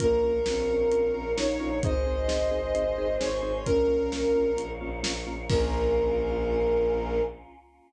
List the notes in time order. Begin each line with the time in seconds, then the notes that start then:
0.00 A#1 A#3 C#4 F4 A#4 C#5 F5, kick, closed hi-hat
0.23 A#1 C#4 F4 A#4
0.46 A#1 C4 C#4 F4 A#4, snare
0.69 A#1 C#4 F4 A#4
0.92 A#1 C#4 F4 A#4, closed hi-hat
1.14 A#1 C#4 F4 A#4
1.37 A#1 C#4 D#4 F4 A#4 C#5, snare
1.60 A#1 C#4 F4 A#4
1.82 G#1 C4 D#4 G#4 C5 D#5, kick, closed hi-hat
2.06 G#1 C4 D#4 G#4
2.28 G#1 C4 D#4 G#4, snare
2.51 G#1 C4 D#4 G#4
2.74 G#1 C4 D#4 G#4, closed hi-hat
2.97 G#1 C4 D#4 G#4
3.20 G#1 C4 D#4 G#4 C#5, snare
3.42 G#1 C4 D#4 G#4
3.65 A#1 A#3 C#4 F4 A#4 C#5 F5, kick, closed hi-hat
3.88 A#1 A#3 C#4 F4
4.12 A#1 A#3 C#4 F4, snare
4.35 A#1 A#3 C#4 F4
4.56 A#1 A#3 C#4 F4, closed hi-hat
4.81 A#1 A#3 C#4 F4
5.03 A#1 A#3 C#4 F4, snare
5.27 A#1 A#3 C#4 F4
5.49 A#1 A#3 C#4 F4 A#4, kick, crash